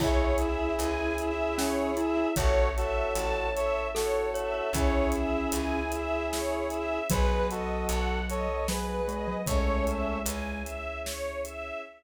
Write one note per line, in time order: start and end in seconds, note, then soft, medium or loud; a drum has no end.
0.00 0.72 C#2 medium
0.00 2.35 C#4 medium
0.00 1.32 E4 medium
0.00 2.28 E4 loud
0.00 2.35 E4 medium
0.00 2.28 G#4 loud
0.00 2.35 G#4 medium
0.00 0.35 C#5 medium
0.00 kick loud
0.00 crash loud
0.38 0.74 E5 medium
0.38 closed hi-hat medium
0.79 2.24 C#2 medium
0.79 1.15 G#5 medium
0.79 closed hi-hat medium
1.18 1.55 E5 medium
1.18 closed hi-hat medium
1.57 1.91 C#4 medium
1.57 1.93 C#5 medium
1.57 snare loud
1.97 2.16 E4 medium
1.97 2.33 E5 medium
1.97 closed hi-hat medium
2.17 2.36 E4 medium
2.36 3.10 A1 medium
2.36 4.71 C#4 medium
2.36 4.71 E4 medium
2.36 2.69 F#4 loud
2.36 2.69 A4 loud
2.36 4.71 A4 medium
2.36 2.71 C#5 loud
2.36 3.74 C#5 loud
2.36 kick loud
2.36 closed hi-hat loud
2.76 3.49 F#4 medium
2.76 3.49 A4 loud
2.76 3.12 E5 medium
2.76 closed hi-hat medium
3.15 4.61 A1 medium
3.15 3.51 A5 medium
3.15 closed hi-hat medium
3.53 3.87 A4 medium
3.53 3.87 C#5 loud
3.53 3.89 E5 medium
3.53 closed hi-hat medium
3.94 4.70 F#4 medium
3.94 4.26 A4 medium
3.94 4.70 A4 medium
3.94 4.30 C#5 medium
3.94 snare loud
4.34 4.53 C#5 medium
4.34 4.72 E5 medium
4.34 closed hi-hat medium
4.54 4.73 C#5 medium
4.73 5.46 C#2 medium
4.73 7.08 C#4 medium
4.73 5.80 C#4 medium
4.73 7.08 E4 medium
4.73 6.99 E4 loud
4.73 7.08 G#4 medium
4.73 6.99 G#4 loud
4.73 5.10 C#5 medium
4.73 kick medium
4.73 closed hi-hat loud
5.12 5.48 E5 medium
5.12 closed hi-hat medium
5.52 6.98 C#2 medium
5.52 5.89 G#5 medium
5.52 closed hi-hat loud
5.92 6.28 E5 medium
5.92 closed hi-hat medium
6.31 6.67 C#5 medium
6.31 snare loud
6.70 7.07 E5 medium
6.70 closed hi-hat medium
7.09 7.84 B1 medium
7.09 8.48 F#3 loud
7.09 9.45 B3 medium
7.09 9.45 D#4 medium
7.09 9.45 F#4 medium
7.09 7.48 G#4 loud
7.09 7.45 B4 loud
7.09 7.48 B4 loud
7.09 kick loud
7.09 closed hi-hat loud
7.50 8.20 F#4 medium
7.50 8.20 A4 loud
7.50 7.85 D#5 medium
7.50 closed hi-hat medium
7.89 9.34 B1 medium
7.89 8.26 F#5 medium
7.89 closed hi-hat medium
8.28 8.67 A4 medium
8.28 8.67 C#5 loud
8.28 8.64 D#5 medium
8.28 closed hi-hat medium
8.68 9.01 F#3 loud
8.68 9.37 G#4 medium
8.68 9.37 B4 loud
8.68 9.05 B4 medium
8.68 snare loud
9.08 9.27 G#3 medium
9.08 9.44 D#5 medium
9.08 closed hi-hat medium
9.28 9.46 F#3 loud
9.46 10.20 C#2 medium
9.46 10.63 G#3 medium
9.46 10.18 A3 medium
9.46 10.18 C#4 loud
9.46 11.82 C#4 medium
9.46 11.82 E4 medium
9.46 11.82 G#4 medium
9.46 9.84 C#5 medium
9.46 kick loud
9.46 closed hi-hat loud
9.86 10.22 E5 medium
9.86 closed hi-hat medium
10.26 11.71 C#2 medium
10.26 10.62 G#5 medium
10.26 closed hi-hat loud
10.64 11.00 E5 medium
10.64 closed hi-hat medium
11.05 11.40 C#5 medium
11.05 snare loud
11.45 11.80 E5 medium
11.45 closed hi-hat medium